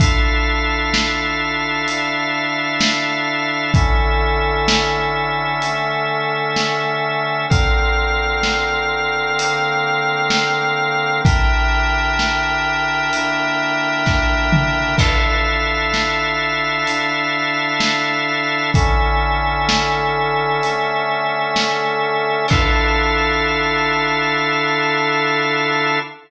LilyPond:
<<
  \new Staff \with { instrumentName = "Brass Section" } { \time 4/4 \key d \minor \tempo 4 = 64 <d e' f' a'>2 <d d' e' a'>2 | <d cis' e' a'>2 <d a cis' a'>2 | <d c' f' bes'>2 <d bes c' bes'>2 | <d e' g' bes'>2 <d bes e' bes'>2 |
<d e' f' a'>2 <d d' e' a'>2 | <d cis' e' a'>2 <d a cis' a'>2 | <d e' f' a'>1 | }
  \new Staff \with { instrumentName = "Drawbar Organ" } { \time 4/4 \key d \minor <d' a' e'' f''>1 | <d cis' a' e''>1 | <d c' bes' f''>1 | <d' bes' e'' g''>1 |
<d' a' e'' f''>1 | <d cis' a' e''>1 | <d' a' e'' f''>1 | }
  \new DrumStaff \with { instrumentName = "Drums" } \drummode { \time 4/4 <hh bd>4 sn4 hh4 sn4 | <hh bd>4 sn4 hh4 sn4 | <hh bd>4 sn4 hh4 sn4 | <hh bd>4 sn4 hh4 <bd sn>8 toml8 |
<cymc bd>4 sn4 hh4 sn4 | <hh bd>4 sn4 hh4 sn4 | <cymc bd>4 r4 r4 r4 | }
>>